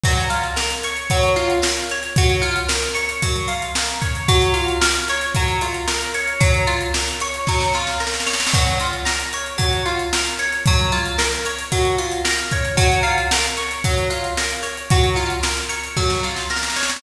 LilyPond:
<<
  \new Staff \with { instrumentName = "Acoustic Guitar (steel)" } { \time 4/4 \key fis \mixolydian \tempo 4 = 113 fis8 eis'8 ais'8 cis''8 fis8 eis'8 ais'8 cis''8 | fis8 eis'8 ais'8 cis''8 fis8 eis'8 ais'8 cis''8 | fis8 eis'8 ais'8 cis''8 fis8 eis'8 ais'8 cis''8 | fis8 eis'8 ais'8 cis''8 fis8 eis'8 ais'8 cis''8 |
fis8 eis'8 ais'8 cis''8 fis8 eis'8 ais'8 cis''8 | fis8 eis'8 ais'8 cis''8 fis8 eis'8 ais'8 cis''8 | fis8 eis'8 ais'8 cis''8 fis8 eis'8 ais'8 cis''8 | fis8 eis'8 ais'8 cis''8 fis8 eis'8 ais'8 cis''8 | }
  \new DrumStaff \with { instrumentName = "Drums" } \drummode { \time 4/4 <cymc bd>16 hh16 hh16 hh16 sn16 <hh sn>16 hh16 hh16 <hh bd>16 hh16 <hh sn>16 hh16 sn16 hh16 hh16 hh16 | <hh bd>16 <hh sn>16 hh16 hh16 sn16 <hh sn>16 hh16 hh16 <hh bd>16 hh16 hh16 hh16 sn16 hh16 <hh bd>16 <hh sn>16 | <hh bd>16 hh16 hh16 hh16 sn16 <hh sn>16 <hh sn>16 <hh sn>16 <hh bd>16 hh16 hh16 hh16 sn16 hh16 hh16 hh16 | <hh bd>16 hh16 <hh sn>16 hh16 sn16 <hh sn>16 hh16 hh16 <bd sn>16 sn16 sn16 sn16 sn32 sn32 sn32 sn32 sn32 sn32 sn32 sn32 |
<cymc bd>16 hh16 hh16 hh16 sn16 <hh sn>16 hh16 hh16 <hh bd>16 hh16 <hh sn>16 hh16 sn16 hh16 hh16 hh16 | <hh bd>16 <hh sn>16 hh16 hh16 sn16 <hh sn>16 hh16 hh16 <hh bd>16 hh16 hh16 hh16 sn16 hh16 <hh bd>16 <hh sn>16 | <hh bd>16 hh16 hh16 hh16 sn16 <hh sn>16 <hh sn>16 <hh sn>16 <hh bd>16 hh16 hh16 hh16 sn16 hh16 hh16 hh16 | <hh bd>16 hh16 <hh sn>16 hh16 sn16 <hh sn>16 hh16 hh16 <bd sn>16 sn16 sn16 sn16 sn32 sn32 sn32 sn32 sn32 sn32 sn32 sn32 | }
>>